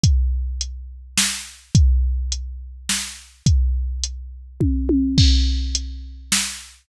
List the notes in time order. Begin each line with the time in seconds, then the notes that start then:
0.04 kick, closed hi-hat
0.61 closed hi-hat
1.18 snare
1.75 kick, closed hi-hat
2.32 closed hi-hat
2.89 snare
3.46 kick, closed hi-hat
4.04 closed hi-hat
4.60 kick, high tom
4.89 high tom
5.18 kick, crash
5.75 closed hi-hat
6.32 snare